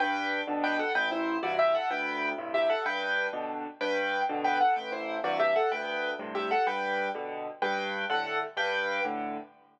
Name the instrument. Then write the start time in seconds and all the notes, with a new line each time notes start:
acoustic grand piano
0.00 G2 B4 G5
0.47 B2 D3
0.64 B4 G5
0.79 A4 F#5
0.95 A1 B4 G5
1.11 E4 C5
1.43 G2 C3 E3 F#4 D5
1.59 G4 E5
1.75 A4 F#5
1.90 D2 B4 G5
2.38 G2 A2 C3
2.54 G4 E5
2.70 A4 F#5
2.86 G2 B4 G5
3.33 B2 D3
3.81 G2 B4 G5
4.29 B2 D3
4.44 B4 G5
4.61 A4 F#5
4.76 A1 B4 G5
4.92 E4 C5
5.24 G2 C3 E3 F#4 D5
5.40 G4 E5
5.56 A4 F#5
5.71 D2 B4 G5
6.19 G2 A2 C3
6.35 G4 E5
6.51 A4 F#5
6.67 G2 B4 G5
7.15 B2 D3
7.62 G2 B4 G5
8.10 A2 D3 A4 F#5
8.57 G2 B4 G5
9.04 A2 D3